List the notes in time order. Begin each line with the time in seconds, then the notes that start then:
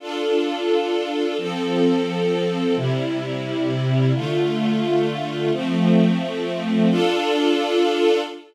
0.00 D4 F4 A4
1.38 F3 C4 A4
2.76 C3 G3 E4
4.14 D3 A3 F4
5.52 F3 A3 C4
6.89 D4 F4 A4